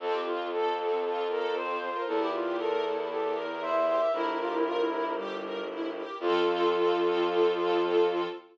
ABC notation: X:1
M:4/4
L:1/16
Q:1/4=116
K:F
V:1 name="Violin"
A G F2 A4 A2 B2 c3 B | A G F2 A4 A2 B2 c3 e | B8 z8 | F16 |]
V:2 name="Flute"
z12 c4 | z12 e4 | E2 F E F E E2 G,4 z4 | F,16 |]
V:3 name="String Ensemble 1"
C2 F2 A2 C2 F2 A2 C2 F2 | E2 G2 B2 E2 G2 B2 E2 G2 | E2 G2 B2 E2 G2 B2 E2 G2 | [CFA]16 |]
V:4 name="Violin" clef=bass
F,,16 | E,,16 | G,,,16 | F,,16 |]
V:5 name="String Ensemble 1"
[CFA]16 | [EGB]16 | [EGB]16 | [CFA]16 |]